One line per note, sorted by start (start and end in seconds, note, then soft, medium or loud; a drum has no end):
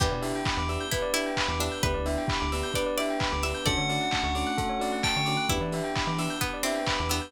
0.00 0.09 E2 medium
0.00 0.91 B3 medium
0.00 0.08 B3 medium
0.00 0.91 D4 medium
0.00 0.08 D4 medium
0.00 0.91 E4 medium
0.00 0.08 E4 medium
0.00 0.65 G4 medium
0.00 0.91 G4 medium
0.00 0.08 G4 medium
0.00 0.11 B4 medium
0.00 kick loud
0.00 crash loud
0.11 0.33 B2 medium
0.11 0.22 D5 medium
0.22 0.39 B3 medium
0.22 0.39 D4 medium
0.22 0.39 E4 medium
0.22 0.39 G4 medium
0.22 0.32 E5 medium
0.22 open hi-hat medium
0.35 0.45 G5 medium
0.45 0.56 B5 medium
0.45 kick medium
0.45 clap loud
0.57 0.78 E2 medium
0.57 0.68 D6 medium
0.69 0.85 B3 medium
0.69 0.85 D4 medium
0.69 0.85 E4 medium
0.69 0.85 G4 medium
0.69 0.79 E6 medium
0.69 open hi-hat medium
0.81 0.91 G6 medium
0.91 1.82 B3 medium
0.91 1.82 D4 medium
0.91 1.12 E4 medium
0.91 1.82 G4 medium
0.91 1.82 B4 medium
0.91 1.03 B4 medium
0.91 kick medium
0.91 closed hi-hat loud
1.02 1.12 D5 medium
1.14 1.30 B3 medium
1.14 1.30 D4 medium
1.14 1.30 E4 medium
1.14 1.52 E4 medium
1.14 1.30 G4 medium
1.14 1.25 E5 medium
1.14 open hi-hat medium
1.26 1.36 G5 medium
1.37 1.48 B5 medium
1.37 kick medium
1.37 clap loud
1.48 1.69 E2 medium
1.48 1.60 D6 medium
1.60 1.68 B3 medium
1.60 1.68 D4 medium
1.60 1.81 D4 medium
1.60 1.68 E4 medium
1.60 1.68 G4 medium
1.60 1.71 E6 medium
1.60 open hi-hat medium
1.72 1.82 G6 medium
1.83 1.95 D2 medium
1.83 1.91 B3 medium
1.83 2.74 B3 medium
1.83 1.91 D4 medium
1.83 2.74 D4 medium
1.83 1.91 E4 medium
1.83 2.74 E4 medium
1.83 1.91 G4 medium
1.83 2.74 G4 medium
1.83 2.46 B4 medium
1.83 1.94 B4 loud
1.83 kick loud
1.83 closed hi-hat medium
1.94 2.17 D2 medium
1.94 2.04 D5 medium
2.06 2.22 B3 medium
2.06 2.22 D4 medium
2.06 2.22 E4 medium
2.06 2.22 G4 medium
2.06 2.16 E5 medium
2.06 open hi-hat medium
2.18 2.28 G5 medium
2.28 2.39 B5 medium
2.28 kick medium
2.28 clap loud
2.40 2.63 D2 medium
2.40 2.50 D6 medium
2.52 2.69 B3 medium
2.52 2.69 D4 medium
2.52 2.69 E4 medium
2.52 2.69 G4 medium
2.52 2.62 E6 medium
2.52 open hi-hat medium
2.63 2.74 G6 medium
2.74 3.65 B3 medium
2.74 3.65 D4 medium
2.74 3.65 G4 medium
2.74 2.85 B4 medium
2.74 3.65 B4 medium
2.74 2.94 D5 medium
2.74 kick medium
2.74 closed hi-hat loud
2.86 2.96 D5 medium
2.98 3.15 B3 medium
2.98 3.15 D4 medium
2.98 3.15 E4 medium
2.98 3.15 G4 medium
2.98 3.42 D5 medium
2.98 3.08 E5 medium
2.98 open hi-hat medium
3.10 3.21 G5 medium
3.20 3.31 B5 medium
3.20 kick medium
3.20 clap loud
3.32 3.53 D2 medium
3.32 3.42 D6 medium
3.43 3.51 B3 medium
3.43 3.51 D4 medium
3.43 3.51 E4 medium
3.43 3.51 G4 medium
3.43 3.65 E5 medium
3.43 3.53 E6 medium
3.43 open hi-hat medium
3.54 3.65 G6 medium
3.66 3.77 D2 medium
3.66 4.57 A3 medium
3.66 3.75 A3 medium
3.66 4.57 C#4 medium
3.66 3.75 C#4 medium
3.66 4.57 D4 medium
3.66 3.75 D4 medium
3.66 4.57 F#4 medium
3.66 3.75 F#4 medium
3.66 3.76 A4 loud
3.66 4.10 D5 medium
3.66 5.01 F#5 medium
3.66 kick loud
3.66 closed hi-hat loud
3.77 3.98 D3 medium
3.77 3.87 C#5 medium
3.89 4.06 A3 medium
3.89 4.06 C#4 medium
3.89 4.06 D4 medium
3.89 4.06 F#4 medium
3.89 3.99 D5 medium
3.89 open hi-hat medium
4.01 4.11 F#5 medium
4.11 4.23 A5 medium
4.11 kick medium
4.11 clap loud
4.23 4.44 D2 medium
4.23 4.35 C#6 medium
4.35 4.51 A3 medium
4.35 4.51 C#4 medium
4.35 4.51 D4 medium
4.35 4.51 F#4 medium
4.35 4.45 D6 medium
4.35 open hi-hat medium
4.47 4.57 F#6 medium
4.58 5.49 A3 medium
4.58 5.49 C#4 medium
4.58 5.49 F#4 medium
4.58 4.68 A4 medium
4.58 5.49 A4 medium
4.58 kick medium
4.58 closed hi-hat loud
4.69 4.79 C#5 medium
4.79 4.96 A3 medium
4.79 4.96 C#4 medium
4.79 4.96 D4 medium
4.79 4.96 F#4 medium
4.79 4.91 D5 medium
4.79 open hi-hat medium
4.92 5.02 F#5 medium
5.03 5.46 G5 medium
5.03 5.14 A5 medium
5.03 kick medium
5.03 clap medium
5.16 5.37 D3 medium
5.16 5.27 C#6 medium
5.26 5.36 A3 medium
5.26 5.36 C#4 medium
5.26 5.36 D4 medium
5.26 5.36 F#4 medium
5.26 5.36 D6 medium
5.26 open hi-hat medium
5.37 5.47 F#6 medium
5.49 5.60 E2 medium
5.49 5.57 B3 medium
5.49 6.40 B3 medium
5.49 5.57 D4 medium
5.49 6.40 D4 medium
5.49 5.57 E4 medium
5.49 6.05 E4 medium
5.49 6.40 E4 medium
5.49 5.57 G4 medium
5.49 6.40 G4 medium
5.49 5.60 B4 medium
5.49 kick loud
5.49 closed hi-hat loud
5.60 5.81 E3 medium
5.60 5.72 D5 medium
5.72 5.89 B3 medium
5.72 5.89 D4 medium
5.72 5.89 E4 medium
5.72 5.89 G4 medium
5.72 5.84 E5 medium
5.72 open hi-hat medium
5.84 5.94 G5 medium
5.96 6.06 B5 medium
5.96 kick medium
5.96 clap loud
6.07 6.28 E3 medium
6.07 6.17 D6 medium
6.18 6.34 B3 medium
6.18 6.34 D4 medium
6.18 6.34 E4 medium
6.18 6.34 G4 medium
6.18 6.29 E6 medium
6.18 open hi-hat medium
6.30 6.41 G6 medium
6.41 6.60 B3 medium
6.41 7.32 B3 medium
6.41 7.32 D4 medium
6.41 7.32 G4 medium
6.41 6.51 B4 medium
6.41 7.32 B4 medium
6.41 kick medium
6.41 closed hi-hat medium
6.54 6.64 D5 medium
6.63 6.80 B3 medium
6.63 7.00 C4 medium
6.63 6.80 D4 medium
6.63 6.80 E4 medium
6.63 6.80 G4 medium
6.63 6.75 E5 medium
6.63 open hi-hat medium
6.75 6.86 G5 medium
6.86 6.97 B5 medium
6.86 kick medium
6.86 clap loud
6.98 7.21 E2 medium
6.98 7.09 D6 medium
7.09 7.19 B3 medium
7.09 7.32 B3 medium
7.09 7.19 D4 medium
7.09 7.19 E4 medium
7.09 7.19 G4 medium
7.09 7.20 E6 medium
7.09 open hi-hat medium
7.22 7.32 G6 medium